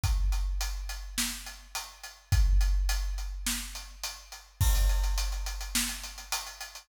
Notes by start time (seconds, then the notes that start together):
0.04 kick, closed hi-hat
0.32 closed hi-hat
0.61 closed hi-hat
0.89 closed hi-hat
1.18 snare
1.46 closed hi-hat
1.75 closed hi-hat
2.03 closed hi-hat
2.32 kick, closed hi-hat
2.61 closed hi-hat
2.89 closed hi-hat
3.18 closed hi-hat
3.46 snare
3.75 closed hi-hat
4.03 closed hi-hat
4.32 closed hi-hat
4.61 kick, crash
4.75 closed hi-hat
4.89 closed hi-hat
5.03 closed hi-hat
5.18 closed hi-hat
5.32 closed hi-hat
5.46 closed hi-hat
5.61 closed hi-hat
5.75 snare
5.89 closed hi-hat
6.03 closed hi-hat
6.18 closed hi-hat
6.32 closed hi-hat
6.46 closed hi-hat
6.61 closed hi-hat
6.75 closed hi-hat